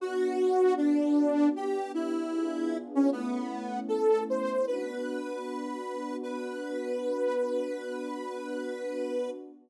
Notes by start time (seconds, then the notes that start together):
0.00 B3 D4 F#4
0.77 D4
1.56 B3 D4 G4
1.94 E4
2.34 B3 D4 F4 G#4
2.95 C#4
3.11 A3 B3 C#4 E4
3.88 A4
4.30 C5
4.67 B3 D4 F#4 B4
6.23 B3 D4 F#4 B4